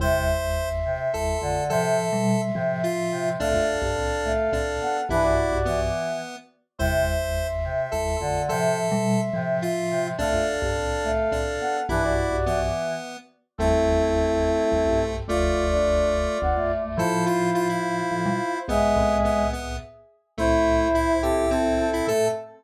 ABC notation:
X:1
M:3/4
L:1/16
Q:1/4=106
K:Am
V:1 name="Brass Section"
[ec']12 | [ec']12 | [Af]12 | [DB] [^Fd]5 z6 |
[ec']12 | [ec']12 | [Af]12 | [DB] [^Fd]5 z6 |
[CA]12 | [Fd]12 | [Ec]12 | [^Ge]6 z6 |
[Ec]6 [CA]2 [CA]2 [CA]2 | A4 z8 |]
V:2 name="Lead 1 (square)"
c6 z2 A4 | A6 z2 F4 | D8 D4 | E4 B,6 z2 |
c6 z2 A4 | A6 z2 F4 | D8 D4 | E4 B,6 z2 |
A,12 | A,8 z4 | A2 F2 F E7 | B,4 B,2 B,2 z4 |
A,4 E2 G2 C3 E | A4 z8 |]
V:3 name="Choir Aahs"
C,2 z4 C,2 z2 D,2 | C,2 z4 C,2 z2 C,2 | A,2 z4 A,2 z2 B,2 | E,2 z2 E,4 z4 |
C,2 z4 C,2 z2 D,2 | C,2 z4 C,2 z2 C,2 | A,2 z4 A,2 z2 B,2 | E,2 z2 E,4 z4 |
E12 | F3 D3 z2 B, A,2 A, | F12 | ^G,6 z6 |
E12 | A,4 z8 |]
V:4 name="Marimba" clef=bass
[G,,,E,,]8 [G,,,E,,]2 [A,,,F,,]2 | [A,,F,]3 [B,,G,]3 [A,,F,]6 | [C,,A,,] [A,,,F,,]2 [B,,,G,,] [C,,A,,]4 [C,,A,,]2 z2 | [B,,,G,,]3 [B,,,G,,]3 z6 |
[G,,,E,,]8 [G,,,E,,]2 [A,,,F,,]2 | [A,,F,]3 [B,,G,]3 [A,,F,]6 | [C,,A,,] [A,,,F,,]2 [B,,,G,,] [C,,A,,]4 [C,,A,,]2 z2 | [B,,,G,,]3 [B,,,G,,]3 z6 |
[G,,,E,,]8 [G,,,E,,] [B,,,G,,]3 | [F,,,D,,]8 [F,,,D,,] [A,,,F,,]3 | [A,,F,]8 [A,,F,] [B,,G,] z2 | [B,,,^G,,]2 [C,,A,,]6 z4 |
[C,,A,,]12 | A,,4 z8 |]